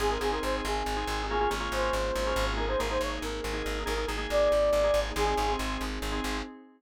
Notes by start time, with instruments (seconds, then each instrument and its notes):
0.00 electric bass (finger) G#1, drawbar organ C4 D#4 G#4, pad 5 (bowed) C4 D#4 G#4, lead 2 (sawtooth) G#4
0.10 drawbar organ C4 D#4 G#4, lead 2 (sawtooth) A#4
0.21 electric bass (finger) G#1, drawbar organ C4 D#4 G#4, lead 2 (sawtooth) G#4
0.32 drawbar organ C4 D#4 G#4, lead 2 (sawtooth) A#4
0.43 electric bass (finger) G#1, lead 2 (sawtooth) C5
0.65 electric bass (finger) G#1, lead 2 (sawtooth) G#4
0.86 electric bass (finger) G#1
0.97 drawbar organ C4 D#4 G#4
1.07 electric bass (finger) G#1
1.29 pad 5 (bowed) A#3 C#4 F4 G#4, drawbar organ A#3 C#4 F4 G#4, lead 2 (sawtooth) G#4
1.41 drawbar organ A#3 C#4 F4 G#4
1.50 electric bass (finger) G#1, drawbar organ A#3 C#4 F4 G#4
1.60 drawbar organ A#3 C#4 F4 G#4
1.72 electric bass (finger) G#1, lead 2 (sawtooth) C5
1.93 electric bass (finger) G#1
2.16 electric bass (finger) G#1
2.27 drawbar organ A#3 C#4 F4 G#4
2.36 electric bass (finger) G#1
2.57 drawbar organ A#3 D#4 G#4, pad 5 (bowed) A#3 D#4 G#4, lead 2 (sawtooth) A#4
2.68 drawbar organ A#3 D#4 G#4, lead 2 (sawtooth) C5
2.79 electric bass (finger) G#1, drawbar organ A#3 D#4 G#4, lead 2 (sawtooth) A#4
2.90 drawbar organ A#3 D#4 G#4, lead 2 (sawtooth) C5
3.01 electric bass (finger) G#1, lead 2 (sawtooth) C#5
3.22 electric bass (finger) G#1, lead 2 (sawtooth) A#4
3.44 electric bass (finger) G#1
3.53 drawbar organ A#3 D#4 G#4
3.66 electric bass (finger) G#1
3.86 electric bass (finger) G#1, drawbar organ A#3 D#4 G#4, pad 5 (bowed) A#3 D#4 G#4, lead 2 (sawtooth) A#4
3.97 drawbar organ A#3 D#4 G#4
4.08 electric bass (finger) G#1, drawbar organ A#3 D#4 G#4
4.18 drawbar organ A#3 D#4 G#4
4.30 electric bass (finger) G#1, lead 2 (sawtooth) D5
4.52 electric bass (finger) G#1
4.73 electric bass (finger) G#1
4.84 drawbar organ A#3 D#4 G#4
4.94 electric bass (finger) G#1
5.16 electric bass (finger) G#1, pad 5 (bowed) C4 D#4 G#4, drawbar organ C4 D#4 G#4, lead 2 (sawtooth) G#4
5.27 drawbar organ C4 D#4 G#4
5.37 electric bass (finger) G#1, drawbar organ C4 D#4 G#4
5.48 drawbar organ C4 D#4 G#4
5.59 electric bass (finger) G#1
5.81 electric bass (finger) G#1
6.02 electric bass (finger) G#1
6.12 drawbar organ C4 D#4 G#4
6.24 electric bass (finger) G#1